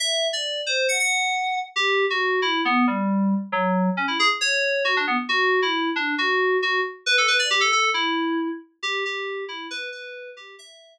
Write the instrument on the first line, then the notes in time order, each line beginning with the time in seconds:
electric piano 2
0.00 E5
0.33 D5
0.66 C5
0.89 F#5
0.99 F#5
1.76 G4
2.10 F#4
2.42 E4
2.65 B3
2.87 G3
3.52 F#3
3.97 C#4
4.08 E4
4.19 G#4
4.41 C#5
4.85 F#4
4.97 D4
5.07 B3
5.29 F#4
5.62 E4
5.96 D4
6.18 F#4
6.62 F#4
7.06 B4
7.18 A4
7.28 B4
7.39 D5
7.50 G4
7.61 A4
7.72 A4
7.94 E4
8.83 G4
9.05 G4
9.48 E4
9.71 B4
9.92 B4
10.37 G4
10.59 E5